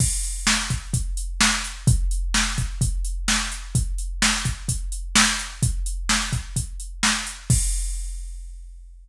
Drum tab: CC |x-------|--------|--------|--------|
HH |-x-xxx-x|xx-xxx-x|xx-xxx-x|xx-xxx-x|
SD |--o---o-|--o---o-|--o---o-|--o---o-|
BD |o--oo---|o--oo---|o--oo---|o--oo---|

CC |x-------|
HH |--------|
SD |--------|
BD |o-------|